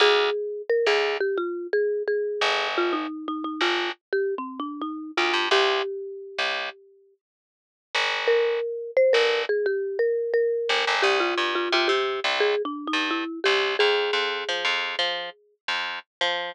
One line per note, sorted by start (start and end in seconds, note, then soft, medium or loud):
0.00 0.30 D2 loud
0.00 0.62 G#4 loud
0.70 0.86 A#4 loud
0.86 1.18 D2 medium
0.86 1.16 G#4 loud
1.20 1.37 G4 loud
1.37 1.67 F4 loud
1.73 2.03 G#4 loud
2.08 2.68 G#4 medium
2.41 3.07 G1 medium
2.78 2.94 F4 loud
2.93 3.26 D#4 loud
3.28 3.44 D#4 loud
3.44 3.61 D#4 medium
3.61 3.92 G1 medium
3.61 3.90 F4 loud
4.13 4.34 G4 loud
4.38 4.60 C4 medium
4.60 4.81 D4 medium
4.81 5.11 D#4 medium
5.17 5.33 D2 medium
5.17 5.47 F4 medium
5.33 5.49 G2 medium
5.51 5.82 C2 loud
5.51 7.14 G4 loud
6.39 6.70 C2 medium
7.95 8.60 G1 medium
8.27 8.91 A#4 loud
8.97 9.13 C5 loud
9.13 9.45 G1 medium
9.13 9.42 A#4 loud
9.49 9.66 G#4 loud
9.66 9.97 G4 loud
9.99 10.32 A#4 medium
10.34 10.95 A#4 loud
10.69 10.85 G1 medium
10.87 11.03 G1 medium
11.02 11.34 C2 medium
11.02 11.19 G4 loud
11.20 11.54 F4 loud
11.37 11.69 G2 medium
11.55 11.72 F4 loud
11.72 11.88 C3 medium
11.72 11.90 F4 loud
11.88 12.20 C3 medium
11.88 12.20 G4 loud
12.24 12.55 C2 medium
12.40 12.62 G#4 loud
12.65 12.87 D4 loud
12.87 13.09 D#4 loud
12.93 13.24 G2 medium
13.11 13.40 E4 loud
13.44 13.76 C2 medium
13.44 13.74 G4 loud
13.79 14.11 F2 medium
13.79 15.54 G#4 loud
14.13 14.44 F2 medium
14.49 14.64 F3 medium
14.65 14.96 F2 medium
14.99 15.30 F3 medium
15.68 15.99 F2 medium
16.21 16.52 F3 medium